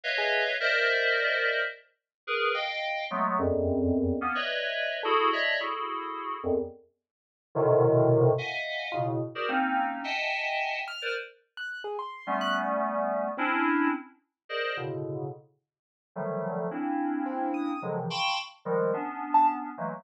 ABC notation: X:1
M:6/4
L:1/16
Q:1/4=108
K:none
V:1 name="Electric Piano 2"
[B^c^def]4 [^A=c=d^de]8 z4 [^GAB]2 [df=g]4 [^F,^G,=A,B,]2 | [E,,F,,^F,,]6 [^A,B,^C] [B^cd^de]5 [E^F^G=A]2 [c=d^de]2 [EFGA]6 [E,,=F,,^F,,] z | z6 [^G,,A,,B,,C,D,^D,]6 [^def^f^g]4 [A,,B,,^C,]2 z [^F=G^G^A=c=d] [^A,C^C^D]4 | [^de^fg^ga]6 z [^ABc=d] z8 [=G,=A,B,^C]8 |
[C^CDE]4 z4 [^G^A=cd^d]2 [=A,,B,,^C,=D,]4 z6 [D,^D,F,^F,=G,A,]4 | [^A,C^CDE]8 [^C,D,^D,F,^F,^G,] [=C,^C,D,E,=F,] [f=g=ab=c'^c']2 z2 [D,F,=G,^G,]2 [B,C=D]6 [E,^F,G,=A,^A,]2 |]
V:2 name="Acoustic Grand Piano"
z ^G2 z21 | z12 A4 z8 | z16 F z7 | z6 f'2 z3 ^f'2 ^G c'3 f' z6 |
C z23 | z4 C2 ^d'2 z11 a z4 |]